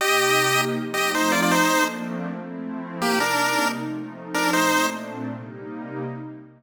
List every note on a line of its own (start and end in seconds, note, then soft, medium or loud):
0.01 0.75 C3 medium
0.01 0.75 A#3 loud
0.01 0.74 D#4 medium
0.01 0.61 G4 medium
0.01 0.75 G4 loud
0.01 0.61 D#5 loud
0.75 1.50 F3 loud
0.75 1.50 A3 medium
0.75 1.50 C4 medium
0.75 1.50 D#4 loud
0.94 1.11 G4 medium
0.94 1.11 D#5 medium
1.14 1.32 D#4 medium
1.14 1.32 C5 medium
1.32 1.41 F4 medium
1.32 1.41 D5 medium
1.42 1.51 F4 medium
1.42 1.51 D5 medium
1.51 2.26 F3 loud
1.51 2.26 A3 loud
1.51 2.26 A#3 loud
1.51 2.26 C4 medium
1.51 2.26 D4 loud
1.51 1.84 D#4 medium
1.51 1.84 C5 loud
2.26 3.01 F3 medium
2.26 3.01 A3 loud
2.26 3.01 C4 loud
2.26 3.01 E4 loud
3.01 3.76 C3 medium
3.01 3.76 G3 medium
3.01 3.19 A#3 medium
3.01 3.76 A#3 medium
3.01 3.76 D#4 loud
3.01 3.19 G4 medium
3.20 3.68 D4 medium
3.20 3.68 A#4 medium
3.78 4.53 F3 medium
3.78 4.52 A3 loud
3.78 4.52 C4 medium
3.78 4.53 D#4 loud
4.34 4.51 D4 medium
4.34 4.51 A#4 medium
4.52 5.27 A#2 loud
4.52 5.27 A3 loud
4.52 5.27 C4 medium
4.52 5.27 D4 medium
4.52 4.86 D#4 medium
4.52 4.86 C5 medium
5.28 6.03 C3 medium
5.28 6.03 G3 medium
5.28 6.03 A#3 loud
5.28 6.03 D#4 loud